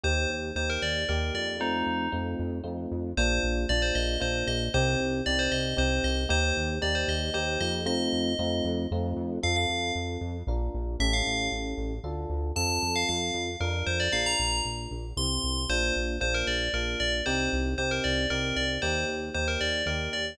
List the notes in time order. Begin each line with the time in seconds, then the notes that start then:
0.04 D#2 A#3 D#4 G4 C5
0.30 D#2
0.55 D#2 A#3 D#4 G4 C5
0.70 A#4
0.82 D#2 D5
1.09 D#2 A#3 D#4 G4 A#4
1.34 F2 D5
1.60 A3 C4 D#4 F4
1.86 F2
2.12 F2 A3 C4 D#4 F4
2.39 F2
2.64 F2 A3 C4 D#4 F4
2.92 F2
3.17 A#1 A#3 D4 F4 C5
3.43 A#1
3.69 A#1 A#3 D4 F4 D5
3.82 C5
3.95 A#1 D#5
4.20 A#1 A#3 D4 F4 C5
4.47 A#1 D#5
4.74 C2 C4 D#4 G4 C5
5.00 C2
5.26 C2 C4 D#4 G4 D5
5.39 C5
5.52 C2 D#5
5.77 C2 C4 D#4 G4 C5
6.04 C2 D#5
6.29 D#2 A#3 D#4 G4 C5
6.57 D#2
6.82 D#2 A#3 D#4 G4 D5
6.95 C5
7.08 D#2 D#5
7.34 D#2 A#3 D#4 G4 C5
7.61 F2 D#5
7.86 A3 C4 D#4 F4 D#5
8.13 F2
8.39 F2 A3 C4 D#4 F4
8.65 F2
8.91 F2 A3 C4 D#4 F4
9.17 F2
9.43 F2 C4 F4 A4 F5
9.56 F5
9.69 F2
9.95 F2
10.21 F2
10.47 A#1 D4 F4 A#4
10.74 A#1
11.00 A1 C#4 E4 G4 A4 E5
11.13 F5
11.27 A1
11.52 A1
11.77 A1
12.04 D2 D4 F4 A4
12.30 D2
12.56 F2 C4 F4 A4 A5
12.82 F2
12.96 F5
13.09 F2 F5
13.34 F2
13.60 F2 D4 F4 A#4
13.87 F2 C5
14.00 D5
14.12 A#1 D4 F4 A#4 F5
14.26 A#5
14.39 A#1
14.65 A#1
14.91 A#1
15.16 C2 C4 E4 G4 C6
15.44 C2
15.69 A#1 A#3 D4 F4 C5
15.96 A#1
16.20 A#1 A#3 D4 F4 C5
16.34 A#4
16.47 A#1 D5
16.74 A#1 A#3 D4 F4 A#4
17.00 A#1 D5
17.26 C2 C4 D#4 G4 C5
17.53 C2
17.78 C2 C4 D#4 G4 C5
17.91 A#4
18.04 C2 D5
18.30 C2 C4 D#4 G4 A#4
18.56 C2 D5
18.82 D#2 A#3 D#4 G4 C5
19.08 D#2
19.34 D#2 A#3 D#4 G4 C5
19.48 A#4
19.61 D#2 D5
19.86 D#2 A#3 D#4 G4 A#4
20.13 D#2 D5